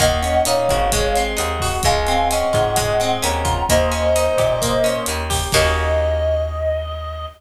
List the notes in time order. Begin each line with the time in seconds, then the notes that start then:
0.00 D#2 A#3 D#5 F#5, kick, cross-stick, closed hi-hat
0.22 C#4, closed hi-hat
0.45 A#2 D#4 C#5 F5, closed hi-hat
0.69 G#1 F#4, kick, cross-stick, closed hi-hat
0.92 G#3, kick, closed hi-hat
1.16 C4, closed hi-hat
1.37 D#2 D#4 D#5 F#5, cross-stick, closed hi-hat
1.60 F#4, kick, open hi-hat
1.83 C#2 G#3 F5 G#5, kick, closed hi-hat
2.07 C4, closed hi-hat
2.31 C#4 D#5 F#5, cross-stick, closed hi-hat
2.53 G#2 F4, kick, closed hi-hat
2.76 G#3, kick, closed hi-hat
3.00 C4, cross-stick, closed hi-hat
3.22 D#2 C#4 F#5 A#5, closed hi-hat
3.45 F4, kick, closed hi-hat
3.69 D#2 A#3 C5 D#5, kick, cross-stick, closed hi-hat
3.92 C#4, closed hi-hat
4.16 D#4, closed hi-hat
4.38 A#2 G4, kick, cross-stick, closed hi-hat
4.62 A#3, kick, closed hi-hat
4.84 C#4, closed hi-hat
5.06 D#2 D#4, cross-stick, closed hi-hat
5.30 G4, kick, open hi-hat
5.52 D#2 A#3 C#4 D#4 F#4 D#5, kick, crash